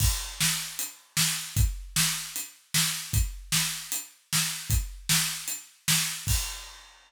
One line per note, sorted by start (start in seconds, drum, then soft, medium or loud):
0.00 kick loud
0.00 crash loud
0.41 snare loud
0.79 closed hi-hat loud
1.17 snare loud
1.56 kick loud
1.56 closed hi-hat loud
1.96 snare loud
2.36 closed hi-hat loud
2.74 snare loud
3.13 kick loud
3.13 closed hi-hat loud
3.52 snare loud
3.92 closed hi-hat loud
4.33 snare loud
4.70 kick loud
4.70 closed hi-hat loud
5.09 snare loud
5.48 closed hi-hat loud
5.88 snare loud
6.27 kick loud
6.27 crash loud